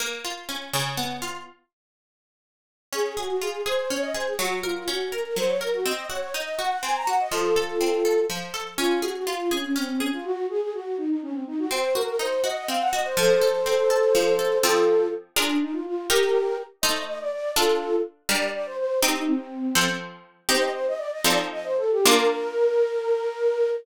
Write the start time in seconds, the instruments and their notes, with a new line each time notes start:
0.00 harpsichord A#3
0.24 harpsichord F4
0.49 harpsichord C#4
0.73 harpsichord C#3
0.97 harpsichord B3
1.22 harpsichord F4
2.93 harpsichord C#4, flute G#4
3.17 flute F#4, harpsichord G#4
3.29 flute F#4
3.41 harpsichord F4, flute G#4
3.66 harpsichord G#4, flute C5
3.77 flute C5
3.89 harpsichord C#4, flute C#5
4.02 flute D#5
4.14 harpsichord G#4, flute C5
4.27 flute G#4
4.38 harpsichord F#3, flute F#4
4.63 flute F4, harpsichord A#4
4.76 flute F4
4.88 harpsichord C#4, flute F#4
5.12 flute A#4, harpsichord A#4
5.25 flute A#4
5.36 harpsichord F#3, flute C5
5.48 flute C#5
5.61 harpsichord A#4, flute A#4
5.74 flute F#4
5.85 harpsichord C4, flute D#5
6.10 harpsichord F#4, flute C#5
6.21 flute C#5
6.34 harpsichord D#4, flute D#5
6.59 harpsichord F#4, flute F#5
6.70 flute F#5
6.83 harpsichord C4, flute G#5
6.96 flute A#5
7.07 harpsichord F#4, flute F#5
7.20 flute D#5
7.32 harpsichord F3, flute F4 A4
7.56 harpsichord A4
7.81 harpsichord C4
8.05 harpsichord A4
8.30 harpsichord F3
8.54 harpsichord A4
8.77 harpsichord C#4, flute F4
9.02 flute F#4, harpsichord G#4
9.16 flute F#4
9.26 flute F4, harpsichord F4
9.51 flute C#4, harpsichord G#4
9.63 flute C#4
9.76 flute C4, harpsichord C#4
9.89 flute C4
9.99 flute C#4, harpsichord G#4
10.13 flute F4
10.24 flute F#4
10.50 flute G#4
10.61 flute G#4
10.73 flute F#4
10.97 flute D#4
11.09 flute D#4
11.22 flute C#4
11.33 flute C4
11.47 flute D#4
11.59 flute F#4
11.71 harpsichord C4, flute C5
11.95 harpsichord F#4, flute A#4
12.08 flute A#4
12.19 harpsichord D#4, flute C5
12.43 harpsichord F#4, flute D#5
12.56 flute D#5
12.68 harpsichord C4, flute F5
12.81 flute F#5
12.93 harpsichord F#4, flute D#5
13.04 flute C5
13.17 harpsichord F3, flute A4 C5
13.41 harpsichord A4
13.66 harpsichord C4
13.90 harpsichord A4
14.15 harpsichord F3
14.39 harpsichord A4
14.63 harpsichord F3 C4 A4, flute F4 A4
15.36 harpsichord D4 F4 G#4 A#4, flute D4
15.62 flute D#4
15.73 flute F4
15.86 flute F4
16.09 harpsichord D#4 G4 A#4, flute G4 A#4
16.82 harpsichord A3 D#4 C5, flute D#5
17.07 flute D#5
17.20 flute D5
17.32 flute D5
17.56 harpsichord D4 F4 A4, flute F4 A4
18.29 harpsichord G3 D4 A#4, flute D5
18.54 flute D5
18.66 flute C5
18.78 flute C5
19.02 harpsichord C4 D#4 G4, flute D#4
19.15 flute D#4
19.27 flute C4
19.75 harpsichord F3 C4 A4
20.49 harpsichord C4 D#4 G4, flute C5
20.60 flute D#5
20.73 flute C5
20.87 flute D#5
20.98 flute D5
21.12 flute D#5
21.24 harpsichord F3 C4 D#4 A4, flute D5
21.52 flute D#5
21.64 flute C5
21.77 flute A4
21.91 flute G4
22.05 harpsichord A#3 D4 F4, flute A#4